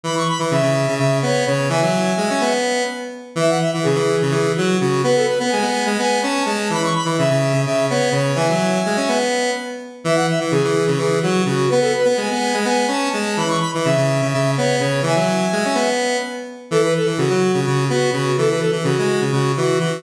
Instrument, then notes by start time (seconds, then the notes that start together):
lead 1 (square)
0.03 E3 B5
0.16 C#6
0.29 B5
0.39 E3
0.51 C#3 E5
0.62 C#3
0.88 C#3
0.98 C#3 E5
1.22 B3 C#5
1.46 C#3 C#5
1.69 E3 E5 G#5
1.82 F#3
2.17 G#3
2.30 C#4
2.41 B3
3.35 E3 E5
3.49 F#5
3.59 E5
3.74 E3
3.83 C#3 G#4
3.95 E3
4.22 C#3
4.31 E3 G#4
4.56 F#3 F#4
4.80 C#3 F#4
5.04 B3 B4
5.16 A4
5.27 B4
5.39 B3
5.49 G#3 G#5
5.62 B3
5.86 G#3
5.99 B3 G#5
6.22 C#4 A5
6.46 G#3 A5
6.70 E3 B5
6.83 C#6
6.95 B5
7.05 E3
7.18 C#3 E5
7.30 C#3
7.53 C#3
7.65 C#3 E5
7.90 B3 C#5
8.12 C#3 C#5
8.35 E3 E5 G#5
8.49 F#3
8.86 G#3
8.97 C#4
9.08 B3
10.04 E3 E5
10.15 F#5
10.28 E5
10.40 E3
10.51 C#3 G#4
10.64 E3
10.87 C#3
10.98 E3 G#4
11.21 F#3 F#4
11.45 C#3 F#4
11.68 B3 B4
11.81 A4
11.96 B4
12.05 B3
12.17 G#3 G#5
12.31 B3
12.54 G#3
12.65 B3 G#5
12.88 C#4 A5
13.12 G#3 A5
13.37 E3 B5
13.48 C#6
13.60 B5
13.74 E3
13.83 C#3 E5
13.97 C#3
14.22 C#3
14.30 C#3 E5
14.57 B3 C#5
14.79 C#3 C#5
15.02 E3 E5 G#5
15.16 F#3
15.52 G#3
15.65 C#4
15.75 B3
16.71 E3 A4
16.83 B4
16.96 A4
17.06 E3
17.18 C#3 F#4
17.30 F#3
17.54 C#3
17.65 C#3 F#4
17.90 B3 F#4
18.12 C#3 F#4
18.38 E3 A4
18.48 B4
18.59 A4
18.72 E3
18.84 C#3 F#4
18.99 G#3
19.21 C#3
19.32 C#3 F#4
19.57 E3 F#4
19.79 E3 F#4